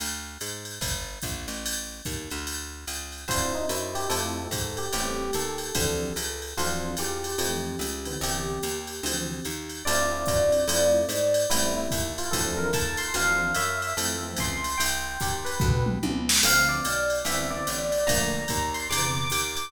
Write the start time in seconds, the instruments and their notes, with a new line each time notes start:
0.00 electric bass (finger) D2, ride
0.40 electric bass (finger) G#2, hi-hat pedal, ride
0.65 ride
0.81 electric bass (finger) G1, kick, ride
1.22 electric bass (finger) A#1, kick, hi-hat pedal, ride
1.48 electric bass (finger) A1, ride
1.66 ride
2.05 electric bass (finger) D#2, kick, hi-hat pedal, ride
2.30 electric bass (finger) D2, ride
2.47 ride
2.87 electric bass (finger) C#2, hi-hat pedal, ride
3.12 ride
3.28 electric bass (finger) D2, electric piano 1 C4 D4 E4 F4 C5, kick, ride
3.55 electric piano 1 D#4
3.69 electric bass (finger) F#2, electric piano 1 E4, hi-hat pedal, ride
3.95 electric piano 1 G4, ride
4.09 electric bass (finger) F2, electric piano 1 A3 C4 E4 F4 A4, ride
4.51 electric bass (finger) G#2, kick, hi-hat pedal, ride
4.77 electric piano 1 G4, ride
4.93 electric bass (finger) A1, electric piano 1 G3 A3 B3 C4 G4, ride
5.33 electric bass (finger) D#2, electric piano 1 A4, hi-hat pedal, ride
5.58 ride
5.75 electric bass (finger) D2, electric piano 1 E3 F3 C4 D4, kick, ride
6.16 electric bass (finger) C#2, hi-hat pedal, ride
6.42 ride
6.57 electric bass (finger) D2, electric piano 1 E3 F3 C4 D4 F4, ride
6.97 electric bass (finger) E2, electric piano 1 G4, hi-hat pedal, ride
7.24 ride
7.38 electric bass (finger) F2, electric piano 1 E3 F3 A3 C4, ride
7.79 electric bass (finger) C#2, hi-hat pedal, ride
8.05 electric piano 1 D3 E3 B3 C4, ride
8.21 electric bass (finger) C2, electric piano 1 G4, ride
8.63 electric bass (finger) D#2, hi-hat pedal, ride
8.87 ride
9.03 electric bass (finger) D2, electric piano 1 D3 E3 F3 C4, ride
9.45 electric bass (finger) D#2, hi-hat pedal, ride
9.69 ride
9.85 electric bass (finger) D2, electric piano 1 C4 D4 E4 F4 D5, ride
10.11 electric piano 1 C4 D4 E4 F4
10.26 electric bass (finger) F#2, electric piano 1 C4 D4 E4 F4, kick, hi-hat pedal, ride
10.52 ride
10.68 electric bass (finger) F2, electric piano 1 A3 C4 E4 F4, ride
11.09 electric bass (finger) G#2, hi-hat pedal, ride
11.34 ride
11.50 electric bass (finger) A1, electric piano 1 G3 A3 B3 C4 E4, ride
11.77 electric piano 1 E4
11.91 electric bass (finger) D#2, kick, hi-hat pedal, ride
12.18 electric piano 1 F4, ride
12.31 electric bass (finger) D2, electric piano 1 E3 F3 C4 D4 A4, kick, ride
12.57 electric piano 1 A#4
12.73 electric bass (finger) D#2, electric piano 1 A5, kick, hi-hat pedal, ride
12.97 electric piano 1 C6, ride
13.14 electric bass (finger) D2, electric piano 1 E3 F3 C4 D4 F5, ride
13.54 electric bass (finger) F#2, electric piano 1 E5, hi-hat pedal, ride
13.82 electric piano 1 E5, ride
13.97 electric bass (finger) F2, electric piano 1 E3 F3 A3 C4, ride
14.23 electric piano 1 E3 F3 A3 C4
14.36 electric bass (finger) C#2, electric piano 1 C6, kick, hi-hat pedal, ride
14.64 ride
14.78 electric bass (finger) C2, electric piano 1 G5, ride
15.20 electric bass (finger) D#2, electric piano 1 G4, kick, hi-hat pedal, ride
15.45 electric piano 1 B4, ride
15.60 electric bass (finger) D2, kick, floor tom
15.86 mid tom
16.03 electric bass (finger) C#2, high tom
16.29 snare
16.43 electric bass (finger) D2, electric piano 1 D3 F3 A3 C4 F5, crash, ride
16.69 electric piano 1 D5
16.84 electric bass (finger) B1, hi-hat pedal, ride
17.10 ride
17.25 electric bass (finger) C2, electric piano 1 D3 E3 B3 C4 E5, ride
17.50 electric piano 1 D3 E3 B3 C4 D5
17.67 electric bass (finger) A1, hi-hat pedal, ride
17.92 ride
18.07 electric bass (finger) A#1, electric piano 1 D3 F3 A3 A#3 A#5, kick, ride
18.32 electric piano 1 A#5
18.48 electric bass (finger) D#2, kick, hi-hat pedal, ride
18.74 electric piano 1 C6, ride
18.90 electric bass (finger) E2, electric piano 1 C3 D3 E3 B3 D6, ride
19.15 electric piano 1 D6
19.30 electric bass (finger) D#2, electric piano 1 D6, hi-hat pedal, ride
19.55 electric piano 1 D6, ride